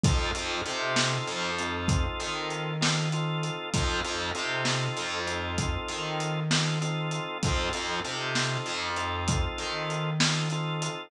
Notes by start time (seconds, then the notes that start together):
0.03 F2 C4 D#4 F4 A4, kick, closed hi-hat
0.35 F2 C4 D#4 F4 A4, closed hi-hat
0.66 C3 C4 D#4 F4 A4, closed hi-hat
0.96 snare
1.27 F2, closed hi-hat
1.59 C4 D#4 F4 A4, closed hi-hat
1.88 kick, closed hi-hat
2.20 D#3, closed hi-hat
2.50 closed hi-hat
2.81 C4 D#4 F4 A4, snare
3.12 C4 D#4 F4 A4, closed hi-hat
3.43 closed hi-hat
3.74 F2 C4 D#4 F4 A4, kick, closed hi-hat
4.04 F2 C4 D#4 F4 A4, closed hi-hat
4.35 C3 C4 D#4 F4 A4, closed hi-hat
4.65 snare
4.97 F2, closed hi-hat
5.27 C4 D#4 F4 A4, closed hi-hat
5.58 kick, closed hi-hat
5.88 D#3, closed hi-hat
6.20 closed hi-hat
6.51 C4 D#4 F4 A4, snare
6.81 C4 D#4 F4 A4, closed hi-hat
7.11 closed hi-hat
7.43 F2 C4 D#4 F4 A4, kick, closed hi-hat
7.73 F2 C4 D#4 F4 A4, closed hi-hat
8.04 C3 C4 D#4 F4 A4, closed hi-hat
8.35 snare
8.66 F2, closed hi-hat
8.96 C4 D#4 F4 A4, closed hi-hat
9.28 kick, closed hi-hat
9.58 D#3, closed hi-hat
9.90 closed hi-hat
10.20 C4 D#4 F4 A4, snare
10.50 C4 D#4 F4 A4, closed hi-hat
10.82 closed hi-hat